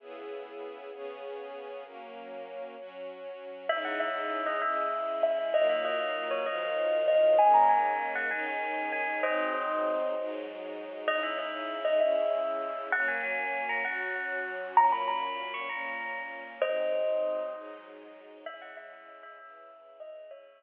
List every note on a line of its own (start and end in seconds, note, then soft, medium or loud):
0.00 0.91 C#3 medium
0.00 0.91 B3 medium
0.00 0.91 E4 medium
0.00 0.91 G#4 medium
0.93 1.84 C#3 medium
0.93 1.84 B3 medium
0.93 1.84 C#4 medium
0.93 1.84 G#4 medium
1.84 2.75 F#3 medium
1.84 2.75 A#3 medium
1.84 2.75 C#4 medium
2.77 3.68 F#3 medium
2.77 3.68 C#4 medium
2.77 3.68 F#4 medium
3.69 4.61 C#3 medium
3.69 4.61 G#3 medium
3.69 4.61 D#4 medium
3.69 4.61 E4 medium
3.69 3.84 E5 medium
3.85 3.99 F#5 medium
4.00 4.45 E5 medium
4.46 4.60 D#5 medium
4.62 5.53 C#3 medium
4.62 5.53 G#3 medium
4.62 5.53 C#4 medium
4.62 5.53 E4 medium
4.62 5.17 E5 medium
5.23 5.49 E5 medium
5.54 6.45 D#3 medium
5.54 6.45 F#3 medium
5.54 6.45 A#3 medium
5.54 6.45 F4 medium
5.54 5.66 D#5 medium
5.69 5.83 E5 medium
5.85 6.26 D#5 medium
6.31 6.44 C#5 medium
6.46 7.38 D#3 medium
6.46 7.38 F3 medium
6.46 7.38 F#3 medium
6.46 7.38 F4 medium
6.46 6.96 D#5 medium
7.08 7.32 D#5 medium
7.38 8.30 D#3 medium
7.38 8.30 G#3 medium
7.38 8.30 A#3 medium
7.38 8.30 C#4 medium
7.38 7.53 G#5 medium
7.54 7.67 A#5 medium
7.69 8.10 G#5 medium
8.15 8.29 F#5 medium
8.31 9.22 D#3 medium
8.31 9.22 G#3 medium
8.31 9.22 C#4 medium
8.31 9.22 D#4 medium
8.31 8.89 G#5 medium
8.92 9.17 G#5 medium
9.22 10.14 G#2 medium
9.22 10.14 F#3 medium
9.22 10.14 C4 medium
9.22 10.14 D#4 medium
9.22 9.85 C5 medium
9.22 9.85 D#5 medium
10.16 11.07 G#2 medium
10.16 11.07 F#3 medium
10.16 11.07 G#3 medium
10.16 11.07 D#4 medium
11.07 11.99 C#3 medium
11.07 11.99 G#3 medium
11.07 11.99 D#4 medium
11.07 11.99 E4 medium
11.07 11.20 D#5 medium
11.23 11.37 E5 medium
11.38 11.80 E5 medium
11.85 11.98 D#5 medium
12.00 12.91 C#3 medium
12.00 12.91 G#3 medium
12.00 12.91 C#4 medium
12.00 12.91 E4 medium
12.00 12.50 E5 medium
12.92 13.84 F#3 medium
12.92 13.84 A#3 medium
12.92 13.84 C#4 medium
12.92 13.06 F#5 medium
13.08 13.21 G#5 medium
13.23 13.64 G#5 medium
13.69 13.82 A#5 medium
13.84 14.75 F#3 medium
13.84 14.75 C#4 medium
13.84 14.75 F#4 medium
13.84 14.39 F#5 medium
14.77 15.68 A#2 medium
14.77 15.68 F#3 medium
14.77 15.68 C#4 medium
14.77 14.92 A#5 medium
14.92 15.07 B5 medium
15.08 15.50 B5 medium
15.54 15.67 C#6 medium
15.69 16.60 A#2 medium
15.69 16.60 A#3 medium
15.69 16.60 C#4 medium
15.69 16.20 A#5 medium
16.62 17.53 G#2 medium
16.62 17.53 F#3 medium
16.62 17.53 C4 medium
16.62 17.53 D#4 medium
16.62 17.40 C5 medium
16.62 17.40 D#5 medium
17.54 18.45 G#2 medium
17.54 18.45 F#3 medium
17.54 18.45 G#3 medium
17.54 18.45 D#4 medium
18.46 19.38 C#3 medium
18.46 19.38 G#3 medium
18.46 19.38 E4 medium
18.46 18.60 E5 medium
18.62 18.74 F#5 medium
18.77 19.15 E5 medium
19.23 19.36 E5 medium
19.38 20.30 C#3 medium
19.38 20.30 E3 medium
19.38 20.30 E4 medium
19.38 19.92 E5 medium
20.00 20.26 D#5 medium
20.31 20.63 C#3 medium
20.31 20.63 G#3 medium
20.31 20.63 E4 medium
20.31 20.63 C#5 medium
20.31 20.63 E5 medium